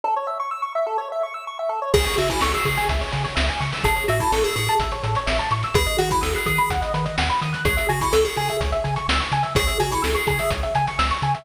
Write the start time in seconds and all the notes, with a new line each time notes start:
0.04 A4
0.16 C#5
0.27 E5
0.40 C#6
0.51 E6
0.62 C#6
0.75 E5
0.87 A4
0.98 C#5
1.12 E5
1.23 C#6
1.34 E6
1.47 C#6
1.59 E5
1.69 A4
1.82 C#5
1.94 C#2 G#4, kick, crash
2.05 C#5, closed hi-hat
2.17 C#3 F#4 E5, closed hi-hat
2.29 E4 G#5, kick, closed hi-hat
2.41 C#2 A4 C#6, snare
2.53 G#4 E6, closed hi-hat
2.65 C#3 G#4 C#6, kick, closed hi-hat
2.77 G#5, closed hi-hat
2.89 C#2 E5, kick, closed hi-hat
3.01 C#5, closed hi-hat
3.12 C#3 G#4, closed hi-hat
3.24 C#5, closed hi-hat
3.35 C#2 E5, snare
3.49 G#5, closed hi-hat
3.60 C#3 C#6, closed hi-hat
3.73 E6, open hi-hat
3.84 A1 G#4 A4, kick, closed hi-hat
3.96 C#5, closed hi-hat
4.08 A2 F#4 E5, closed hi-hat
4.20 E4 A5, kick, closed hi-hat
4.32 A1 A4 C#6, snare
4.44 G#4 E6, closed hi-hat
4.56 A2 G#4 C#6, closed hi-hat
4.68 A5, closed hi-hat
4.79 A1 E5, kick, closed hi-hat
4.91 C#5, closed hi-hat
5.03 A2 A4, closed hi-hat
5.15 C#5, closed hi-hat
5.26 A1 E5, snare
5.39 A5, closed hi-hat
5.51 A2 C#6, closed hi-hat
5.63 E6, closed hi-hat
5.74 D#2 G#4 B4, kick, closed hi-hat
5.86 D#5, closed hi-hat
5.98 D#3 F#4 F#5, closed hi-hat
6.11 E4 B5, kick, closed hi-hat
6.21 D#2 A4 D#6, snare
6.35 G#4 F#6, closed hi-hat
6.46 D#3 G#4 D#6, kick, closed hi-hat
6.58 B5, closed hi-hat
6.70 D#2 F#5, kick, closed hi-hat
6.82 D#5, closed hi-hat
6.94 D#3 B4, closed hi-hat
7.05 D#5, closed hi-hat
7.18 D#2 F#5, snare
7.29 B5, closed hi-hat
7.41 D#3 D#6, closed hi-hat
7.53 F#6, closed hi-hat
7.65 C#2 G#4 C#5, kick, closed hi-hat
7.77 E5, closed hi-hat
7.89 C#3 F#4 G#5, closed hi-hat
8.01 E4 C#6, kick, closed hi-hat
8.13 C#2 A4 E6, snare
8.25 G#4 C#6, closed hi-hat
8.36 C#3 G#4 G#5, closed hi-hat
8.49 E5, closed hi-hat
8.61 C#2 C#5, kick, closed hi-hat
8.72 E5, closed hi-hat
8.84 C#3 G#5, closed hi-hat
8.96 C#6, closed hi-hat
9.08 C#2 E6, snare
9.20 C#6, closed hi-hat
9.32 C#3 G#5, closed hi-hat
9.43 E5, closed hi-hat
9.55 C#2 G#4 C#5, kick, closed hi-hat
9.67 E5, closed hi-hat
9.80 C#3 F#4 G#5, closed hi-hat
9.91 E4 C#6, kick, closed hi-hat
10.02 C#2 A4 E6, snare
10.15 G#4 C#6, closed hi-hat
10.27 C#3 G#4 G#5, kick, closed hi-hat
10.39 E5, closed hi-hat
10.50 C#2 C#5, kick, closed hi-hat
10.63 E5, closed hi-hat
10.75 C#3 G#5, closed hi-hat
10.87 C#6, closed hi-hat
10.99 C#2 E6, snare
11.11 C#6, closed hi-hat
11.22 C#3 G#5, closed hi-hat
11.35 E5, closed hi-hat